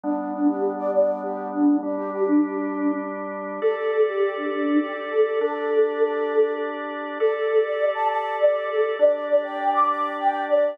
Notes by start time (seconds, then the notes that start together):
0.03 G3 B3 D4
0.18 D4
0.33 D4
0.48 G4
0.78 D5
0.93 D5
1.23 G4
1.53 D4
1.83 G3 D4 G4
1.98 G4
2.12 G4
2.27 D4
3.62 G4 A4 D5
3.77 A4
3.92 A4
4.06 G4
4.36 D4
4.51 D4
4.81 G4
5.11 A4
5.41 D4 G4 A4 D5
7.20 G4 A4 D5
7.35 A4
7.50 A4
7.65 D5
7.95 A5
8.09 A5
8.39 D5
8.69 A4
8.99 D4 G4 D5
9.14 D5
9.29 D5
9.44 G5
9.74 D6
9.89 D6
10.18 G5
10.48 D5